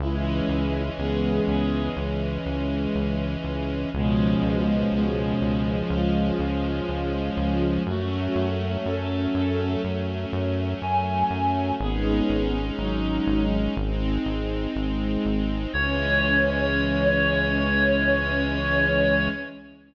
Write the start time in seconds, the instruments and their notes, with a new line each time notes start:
0.00 synth bass 1 C#2, string ensemble 1 E3 G#3 C#4, violin G#3 E4
0.49 synth bass 1 C#2
0.98 synth bass 1 C#2, violin B3 G#4
1.47 synth bass 1 C#2, violin B3 G#4
1.97 synth bass 1 C#2
2.46 synth bass 1 C#2
2.95 synth bass 1 C#2
3.44 synth bass 1 C#2
3.93 synth bass 1 C#2, violin B2 G#3, string ensemble 1 F3 G#3 C#4
4.42 synth bass 1 C#2
4.92 synth bass 1 C#2, violin B2 G#3
5.41 synth bass 1 C#2
5.90 synth bass 1 C#2, violin G#3 F4
6.39 synth bass 1 C#2
6.88 synth bass 1 C#2
7.37 synth bass 1 C#2
7.86 synth bass 1 F#2, string ensemble 1 F#3 A3 C#4, violin A3 F#4
8.35 synth bass 1 F#2
8.85 synth bass 1 F#2, violin C#4 A4
9.35 synth bass 1 F#2, violin C#4 A4
9.84 synth bass 1 F#2
10.33 synth bass 1 F#2
10.82 synth bass 1 F#2, clarinet G#5
11.31 synth bass 1 F#2
11.80 synth bass 1 G#1, string ensemble 1 G#3 C#4 D#4, violin B3 G#4
12.29 synth bass 1 G#1
12.79 synth bass 1 G#1, violin F#3 D#4
13.27 synth bass 1 G#1
13.77 synth bass 1 G#1, string ensemble 1 G#3 C4 D#4
14.26 synth bass 1 G#1
14.76 synth bass 1 G#1
15.25 synth bass 1 G#1
15.73 synth bass 1 C#2, string ensemble 1 E3 G#3 C#4, violin C#4, clarinet C#5